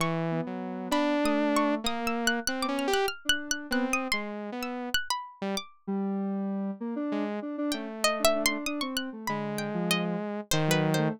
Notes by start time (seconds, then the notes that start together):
0.00 E3 C#6
0.31 B3
0.47 F#3
0.91 D4 B5
1.24 A3 D#6
1.56 C#6
1.84 A#3 D#6
2.07 E6
2.27 F#6
2.47 C4 F#6
2.63 B3 D6
2.68 C#4
2.79 F6
2.88 G4
2.94 F#6
3.08 F6
3.25 D4
3.29 F#6
3.51 F#6
3.71 B3 C4 F#6
3.93 D#6
4.12 G#3 C6
4.52 B3
4.63 E6
4.94 F#6
5.10 B5
5.42 G3
5.57 D6
5.87 G3
6.80 A#3
6.96 D4
7.12 G#3
7.42 D4
7.58 D4
7.72 A3 C#4 G5
8.04 D#5
8.19 D4
8.25 E5
8.35 D4
8.46 C6
8.51 D4
8.66 D4 D#6
8.81 C4 C#6
8.97 F#6
9.13 A3
9.27 D3 G#3 B5
9.58 G5
9.74 F3
9.91 D#5
10.51 D#3 C5
10.67 F#3 B4
10.94 A3 C5